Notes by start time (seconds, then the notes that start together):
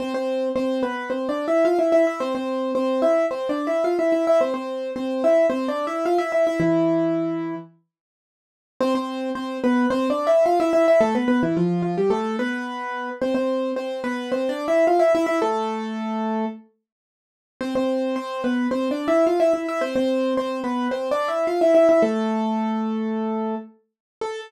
0.00 C4 C5
0.14 C4 C5
0.56 C4 C5
0.83 B3 B4
1.10 C4 C5
1.29 D4 D5
1.48 E4 E5
1.65 F4 F5
1.79 E4 E5
1.92 E4 E5
2.07 E4 E5
2.20 C4 C5
2.35 C4 C5
2.75 C4 C5
3.02 E4 E5
3.31 C4 C5
3.49 D4 D5
3.67 E4 E5
3.84 F4 F5
3.99 E4 E5
4.12 E4 E5
4.27 E4 E5
4.41 C4 C5
4.54 C4 C5
4.96 C4 C5
5.24 E4 E5
5.50 C4 C5
5.68 D4 D5
5.87 E4 E5
6.06 F4 F5
6.18 E4 E5
6.32 E4 E5
6.47 E4 E5
6.60 E3 E4
8.81 C4 C5
8.95 C4 C5
9.35 C4 C5
9.64 B3 B4
9.90 C4 C5
10.10 D4 D5
10.27 E4 E5
10.46 F4 F5
10.60 E4 E5
10.73 E4 E5
10.88 E4 E5
11.01 A3 A4
11.15 B3 B4
11.28 B3 B4
11.43 E3 E4
11.57 F3 F4
11.82 F3 F4
11.98 G3 G4
12.10 A3 A4
12.39 B3 B4
13.22 C4 C5
13.35 C4 C5
13.76 C4 C5
14.04 B3 B4
14.32 C4 C5
14.49 D4 D5
14.68 E4 E5
14.87 F4 F5
14.99 E4 E5
15.15 E4 E5
15.26 E4 E5
15.42 A3 A4
17.61 C4 C5
17.75 C4 C5
18.16 C4 C5
18.44 B3 B4
18.71 C4 C5
18.91 D4 D5
19.08 E4 E5
19.27 F4 F5
19.40 E4 E5
19.54 E4 E5
19.68 E4 E5
19.81 C4 C5
19.96 C4 C5
20.37 C4 C5
20.64 B3 B4
20.91 C4 C5
21.11 D4 D5
21.28 E4 E5
21.47 F4 F5
21.61 E4 E5
21.75 E4 E5
21.89 E4 E5
22.02 A3 A4
24.21 A4